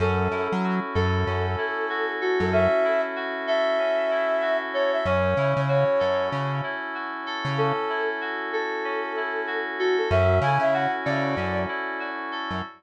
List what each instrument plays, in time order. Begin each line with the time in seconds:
0.00 synth bass 1 F#2, electric piano 2 C#4, flute A4
0.31 synth bass 1 F#2, electric piano 2 E4
0.52 synth bass 1 F#3
0.64 electric piano 2 F#4
0.95 synth bass 1 F#2, flute A4, electric piano 2 A4
1.26 synth bass 1 F#2, electric piano 2 C#4
1.58 electric piano 2 E4
1.89 electric piano 2 F#4
2.21 flute F#4, electric piano 2 A4
2.40 synth bass 1 F#2, flute A4
2.52 electric piano 2 C#4, flute E5
2.85 electric piano 2 E4
3.16 electric piano 2 F#4
3.47 electric piano 2 A4, flute E5
3.79 electric piano 2 C#4
4.11 electric piano 2 E4
4.42 electric piano 2 F#4
4.74 electric piano 2 A4, flute C#5
4.93 flute E5
5.05 synth bass 1 F#2, electric piano 2 C#4, flute C#5
5.37 synth bass 1 C#3, electric piano 2 E4
5.57 synth bass 1 C#3
5.68 electric piano 2 F#4, flute C#5
5.99 synth bass 1 F#2, electric piano 2 A4
6.32 synth bass 1 C#3, electric piano 2 C#4
6.63 electric piano 2 E4
6.94 electric piano 2 F#4
7.26 electric piano 2 A4
7.45 synth bass 1 C#3
7.58 electric piano 2 C#4, flute A4
7.89 electric piano 2 E4
8.21 electric piano 2 F#4
8.53 flute A4, electric piano 2 A4
8.84 electric piano 2 C#4
9.16 electric piano 2 E4
9.47 electric piano 2 F#4
9.79 flute F#4, electric piano 2 A4
9.98 flute A4
10.10 synth bass 1 F#2, electric piano 2 C#4, flute E5
10.41 synth bass 1 C#3, electric piano 2 E4, flute G#5
10.59 synth bass 1 C#3, flute E5
10.73 electric piano 2 F#4, flute F#5
11.05 synth bass 1 C#3, electric piano 2 A4, flute D5
11.37 synth bass 1 F#2, electric piano 2 C#4
11.68 electric piano 2 E4
12.00 electric piano 2 F#4
12.32 electric piano 2 A4
12.51 synth bass 1 F#2